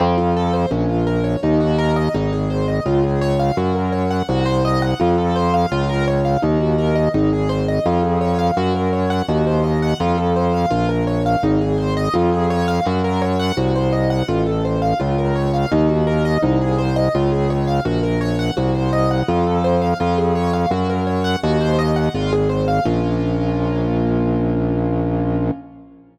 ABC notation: X:1
M:4/4
L:1/16
Q:1/4=84
K:Bbm
V:1 name="Acoustic Grand Piano"
C F =A c D F B d E G B e E _A c e | F A d f G B d g G c e g F =A c f | F B d f E G B e E A c e F A d f | G B d g G c e g F =A c f F B d f |
E A c e F A d f G B d g G c e g | F =A c f F B d f E G B e E _A c e | F A d f G B d g G c e g F =A c f | F A d f G B d g G c e g F A c f |
[B,DF]16 |]
V:2 name="Drawbar Organ" clef=bass
F,,4 B,,,4 E,,4 A,,,4 | D,,4 G,,4 C,,4 F,,4 | D,,4 E,,4 A,,,4 F,,4 | G,,4 E,,4 F,,4 B,,,4 |
A,,,4 F,,4 G,,4 C,,4 | =A,,,4 D,,4 E,,4 C,,4 | D,,4 B,,,4 C,,4 F,,4 | F,,4 G,,4 E,,4 A,,,4 |
B,,,16 |]